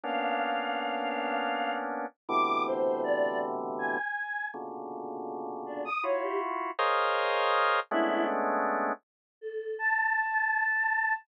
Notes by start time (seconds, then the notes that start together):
0.03 A#3 B3 C#4 D4 F5
2.29 A2 B2 C3 D3 E3 D6
2.66 C5
3.04 D5
3.79 G#5
4.54 A#2 B2 C#3 D3
5.66 D4
5.85 D#6
6.03 E4 F4 F#4 C#5
6.22 G4
6.79 G#4 A#4 C5 C#5 D#5 F5
7.91 G#3 A3 B3 C#4 D4 E4
9.41 A4
9.79 A5